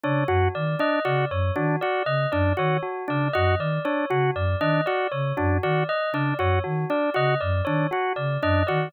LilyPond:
<<
  \new Staff \with { instrumentName = "Flute" } { \clef bass \time 7/8 \tempo 4 = 118 cis8 fis,8 dis8 r8 cis8 fis,8 dis8 | r8 cis8 fis,8 dis8 r8 cis8 fis,8 | dis8 r8 cis8 fis,8 dis8 r8 cis8 | fis,8 dis8 r8 cis8 fis,8 dis8 r8 |
cis8 fis,8 dis8 r8 cis8 fis,8 dis8 | }
  \new Staff \with { instrumentName = "Drawbar Organ" } { \time 7/8 d'8 fis'8 r8 d'8 fis'8 r8 d'8 | fis'8 r8 d'8 fis'8 r8 d'8 fis'8 | r8 d'8 fis'8 r8 d'8 fis'8 r8 | d'8 fis'8 r8 d'8 fis'8 r8 d'8 |
fis'8 r8 d'8 fis'8 r8 d'8 fis'8 | }
  \new Staff \with { instrumentName = "Tubular Bells" } { \time 7/8 cis''8 fis'8 d''8 dis''8 d''8 cis''8 fis'8 | d''8 dis''8 d''8 cis''8 fis'8 d''8 dis''8 | d''8 cis''8 fis'8 d''8 dis''8 d''8 cis''8 | fis'8 d''8 dis''8 d''8 cis''8 fis'8 d''8 |
dis''8 d''8 cis''8 fis'8 d''8 dis''8 d''8 | }
>>